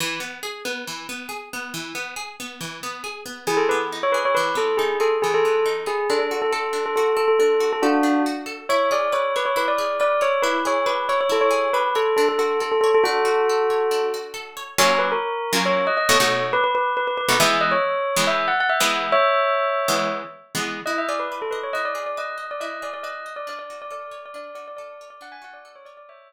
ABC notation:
X:1
M:4/4
L:1/16
Q:1/4=138
K:Emix
V:1 name="Tubular Bells"
z16 | z16 | [M:2/4] G A B z2 c B c | [M:4/4] B2 A2 G2 A z G A3 z2 G2 |
A A2 A A3 A A2 A A A3 A | [M:2/4] [DF]4 z4 | [M:4/4] c2 d2 c2 B c B d3 d2 c2 | B2 c2 B2 c c A c3 B2 A2 |
[M:2/4] A A A2 A A A A | [M:4/4] [FA]10 z6 | [K:F#mix] c2 B A5 c2 d d c4 | [M:2/4] B B B2 B B B B |
[M:4/4] e2 d c5 e2 f f e4 | [ce]10 z6 | [M:2/4] [K:Emix] ^d e =d B2 A B c | [M:4/4] ^d =d2 d ^d3 =d ^d2 =d d ^d3 =d |
d d2 d d3 d d2 d d d3 d | [M:2/4] f g f d2 c d d | [M:4/4] [ce]10 z6 |]
V:2 name="Acoustic Guitar (steel)"
E,2 B,2 G2 B,2 E,2 B,2 G2 B,2 | E,2 B,2 G2 B,2 E,2 B,2 G2 B,2 | [M:2/4] E,2 B,2 ^D2 G2 | [M:4/4] E,2 B,2 ^D2 G2 E,2 B,2 D2 G2 |
D2 F2 A2 D2 F2 A2 D2 F2 | [M:2/4] A2 D2 F2 A2 | [M:4/4] E2 G2 B2 c2 E2 G2 B2 c2 | E2 G2 B2 c2 E2 G2 B2 c2 |
[M:2/4] D2 F2 A2 c2 | [M:4/4] D2 F2 A2 c2 D2 F2 A2 c2 | [K:F#mix] [F,A,C^E]7 [F,A,CE]5 [B,,=A,DF] [B,,A,DF]3- | [M:2/4] [B,,=A,DF]7 [B,,A,DF] |
[M:4/4] [E,G,B,]7 [E,G,B,]6 [E,G,B,]3- | [E,G,B,]7 [E,G,B,]6 [E,G,B,]3 | [M:2/4] [K:Emix] E2 G2 B2 ^d2 | [M:4/4] E2 G2 B2 ^d2 E2 G2 B2 d2 |
D2 F2 A2 c2 D2 F2 A2 c2 | [M:2/4] D2 F2 A2 c2 | [M:4/4] z16 |]